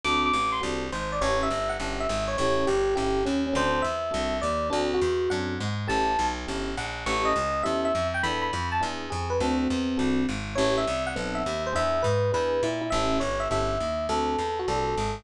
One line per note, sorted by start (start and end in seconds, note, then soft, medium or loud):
0.04 0.32 D2 medium
0.04 0.28 C4 medium
0.04 0.28 D4 medium
0.04 0.28 F#4 loud
0.04 0.28 A4 loud
0.04 0.21 D6 loud
0.26 0.50 D6 medium
0.33 0.61 A1 medium
0.52 0.60 C6 medium
0.61 0.91 C2 medium
0.61 0.85 C4 medium
0.61 0.85 D4 medium
0.61 0.85 F#4 medium
0.61 0.85 A4 medium
0.92 1.20 G#1 medium
0.92 1.10 C5 medium
1.12 1.21 D5 medium
1.21 1.49 A1 medium
1.21 1.45 C#4 medium
1.21 1.45 E4 medium
1.21 1.45 G4 medium
1.21 1.45 A4 medium
1.21 1.39 C#5 loud
1.43 1.71 E5 loud
1.50 1.78 G1 medium
1.69 1.91 F#5 medium
1.80 2.07 G1 medium
1.80 2.04 C#4 medium
1.80 2.04 E4 medium
1.80 2.04 G4 medium
1.80 2.04 A4 medium
2.00 2.25 E5 medium
2.09 2.37 G#1 medium
2.28 2.36 C#5 medium
2.38 2.66 A1 medium
2.38 2.64 C#4 medium
2.38 2.64 E4 loud
2.38 2.64 G4 loud
2.38 2.64 A4 medium
2.38 2.64 C#5 loud
2.67 2.95 G1 medium
2.67 2.94 G4 medium
2.95 3.24 G1 medium
2.95 3.19 C#4 medium
2.95 3.19 E4 medium
2.95 3.19 G4 medium
2.95 3.23 G4 medium
2.95 3.19 A4 medium
3.25 3.54 D#2 medium
3.25 3.42 C#4 medium
3.46 3.55 C#4 medium
3.53 3.83 D2 medium
3.53 3.77 C4 medium
3.53 3.77 D4 medium
3.53 3.77 F#4 loud
3.53 3.77 A4 medium
3.53 3.85 C5 loud
3.82 4.12 E2 medium
3.82 4.37 E5 medium
4.11 4.41 C2 medium
4.11 4.35 C4 medium
4.11 4.35 D4 medium
4.11 4.35 F#4 medium
4.11 4.35 A4 medium
4.42 4.70 D#2 medium
4.42 4.68 D5 medium
4.70 5.00 D2 medium
4.70 4.95 C4 loud
4.70 4.88 D4 loud
4.70 4.95 D4 loud
4.70 4.95 F#4 loud
4.70 4.95 A4 medium
4.94 5.29 F#4 loud
5.01 5.29 E2 medium
5.30 5.59 F#2 medium
5.30 5.54 C4 medium
5.30 5.54 D4 medium
5.30 5.54 F#4 medium
5.30 5.54 A4 medium
5.30 5.58 F#5 medium
5.60 5.88 G#2 medium
5.88 6.17 A1 medium
5.88 6.11 C#4 medium
5.88 6.11 E4 loud
5.88 6.11 G4 loud
5.88 6.11 A4 loud
5.88 6.26 A5 medium
6.19 6.46 B1 medium
6.47 6.76 G1 medium
6.47 6.71 C#4 medium
6.47 6.71 E4 medium
6.47 6.71 G4 medium
6.47 6.71 A4 medium
6.77 7.05 A#1 medium
6.77 7.05 F#5 medium
7.06 7.34 A1 medium
7.06 7.30 C#4 loud
7.06 7.30 E4 medium
7.06 7.30 G4 medium
7.06 7.30 A4 medium
7.06 7.26 C#6 loud
7.25 7.62 D#5 loud
7.36 7.63 C#2 medium
7.63 7.93 E2 medium
7.63 7.87 C#4 medium
7.63 7.87 E4 medium
7.63 7.87 G4 medium
7.63 7.87 A4 medium
7.63 7.81 E5 medium
7.85 8.07 E5 medium
7.95 8.22 F2 medium
8.14 8.22 G5 medium
8.23 8.51 E2 medium
8.23 8.47 B3 medium
8.23 8.47 D4 loud
8.23 8.47 E4 loud
8.23 8.47 A4 medium
8.23 8.40 B5 loud
8.42 8.68 B5 medium
8.53 8.80 F2 medium
8.72 8.81 A5 medium
8.81 9.10 E2 medium
8.81 9.05 B3 medium
8.81 9.05 D4 medium
8.81 9.05 E4 loud
8.81 9.05 G#4 loud
9.10 9.39 F2 medium
9.10 9.29 G#4 medium
9.30 9.38 B4 medium
9.40 9.68 D2 medium
9.40 9.65 C4 medium
9.40 10.23 C4 medium
9.40 9.65 D4 loud
9.40 9.65 F#4 loud
9.40 9.65 A4 medium
9.70 9.98 E2 medium
9.97 10.26 C2 medium
9.97 10.21 C4 medium
9.97 10.21 D4 medium
9.97 10.21 F#4 medium
9.97 10.21 A4 medium
10.29 10.56 G#1 medium
10.55 10.85 A1 medium
10.55 10.80 C#4 loud
10.55 10.80 E4 loud
10.55 10.80 G4 medium
10.55 10.80 A4 medium
10.55 10.74 C#5 medium
10.78 11.03 E5 medium
10.87 11.15 C2 medium
11.07 11.34 F#5 loud
11.16 11.44 B1 medium
11.16 11.39 B3 loud
11.16 11.39 C4 loud
11.16 11.39 D#4 medium
11.16 11.39 A4 medium
11.35 11.63 E5 medium
11.46 11.74 D#2 medium
11.67 11.75 C5 medium
11.73 12.03 E2 medium
11.73 11.97 B3 medium
11.73 11.97 D4 medium
11.73 11.97 E4 medium
11.73 11.97 G#4 loud
11.73 12.02 E5 loud
12.02 12.32 G#2 medium
12.02 12.30 B4 medium
12.32 12.61 E2 medium
12.32 12.56 B3 medium
12.32 12.56 D4 medium
12.32 12.56 E4 medium
12.32 12.56 G#4 medium
12.32 12.62 B4 loud
12.63 12.90 A#2 medium
12.63 12.81 E4 loud
12.81 12.89 E4 medium
12.90 13.20 A1 medium
12.90 13.18 C#4 medium
12.90 13.18 E4 loud
12.90 13.18 G4 medium
12.90 13.18 A4 medium
12.90 13.17 E5 loud
13.20 13.48 G1 medium
13.20 13.39 C#5 medium
13.40 13.48 E5 medium
13.50 13.78 G1 medium
13.50 13.74 C#4 medium
13.50 13.74 E4 medium
13.50 13.74 G4 medium
13.50 13.74 A4 medium
13.50 14.06 E5 medium
13.80 14.08 D#2 medium
14.09 14.36 D2 medium
14.09 14.33 C4 medium
14.09 14.33 D4 medium
14.09 14.33 F#4 medium
14.09 14.33 A4 medium
14.09 14.57 A4 loud
14.38 14.66 E2 medium
14.59 14.68 F#4 medium
14.68 14.95 C2 medium
14.68 14.93 C4 medium
14.68 14.93 D4 medium
14.68 14.93 F#4 medium
14.68 15.15 A4 medium
14.68 14.93 A4 medium
14.97 15.24 G#1 medium